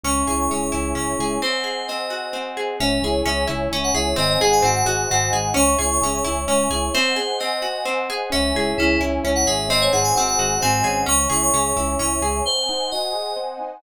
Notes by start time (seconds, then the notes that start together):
0.04 C#2 C#4 C#5 E5 G#5 C#6
0.16 C#6
0.27 C#2 E4 G#4 C#6
0.39 C#6
0.50 C#2 C#4 G#4 C#6
0.62 C#6
0.72 C#2 E4
0.95 C#2 C#4 C#6
1.19 C#2 E4 G#4
1.42 C4 C5 D#5 F#5 G#5
1.64 G#4
1.88 C4 D#5
2.10 F#4
2.33 C4
2.57 G#4
2.80 C#2 C#4 C#5 E5 G#5
3.02 C#2 E4 G#4
3.26 C#2 C#4 G#4 E5
3.48 C#2 E4
3.72 C#2 C#4
3.84 F#5
3.94 C#2 E4 G#4 E5
4.16 G#1 C4 C5 D#5 F#5 G#5
4.30 D#5
4.40 G#1 D#4 G#4 F#5
4.52 G#5
4.62 G#1 C4 F#4 F#5
4.75 F#5
4.85 G#1 F#4 G#4
5.10 G#1 C4 F#4 F#5
5.32 G#1 D#4 G#4
5.54 C#2 C#4 C#5 E5 G#5 C#6
5.68 C#6
5.79 C#2 E4 G#4 C#6
5.91 C#6
6.01 C#2 C#4 G#4 C#6
6.14 C#6
6.24 C#2 E4
6.48 C#2 C#4 C#6
6.70 C#2 E4 G#4
6.94 C4 C5 D#5 F#5 G#5
7.16 G#4
7.40 C4 D#5
7.62 F#4
7.85 C4
8.10 G#4
8.30 C#2 C#4 C#5 E5 G#5
8.54 C#2 E4 G#4
8.78 C#2 C#4 E4 G#4
9.00 C#2 C#4 E4
9.24 C#2 C#4 E4
9.35 F#5
9.46 G#1 G#4 E5
9.69 C4 C5 D#5 F#5 G#5
9.82 C#5
9.92 G#1 D#4 G#4 F#5
10.04 G#5
10.15 G#1 C4 F#4 F#5
10.27 F#5
10.37 G#1 F#4 G#4
10.61 G#1 C4 G#5
10.84 G#1 C#4 G#4
11.06 C#2 C#4 C#5 E5 G#5 C#6
11.19 C#6
11.30 C#2 E4 G#4 C#6
11.42 C#6
11.54 C#2 C#4 G#4 C#6
11.65 C#6
11.76 C#2 C#4 E4
11.99 C#2 C#4 E4 C#6
12.22 C#2 G#4
12.45 C4 C5 D#5 F#5 G#5
12.69 D#4
12.91 F#4 D#5
13.13 G#4
13.36 C4
13.60 D#4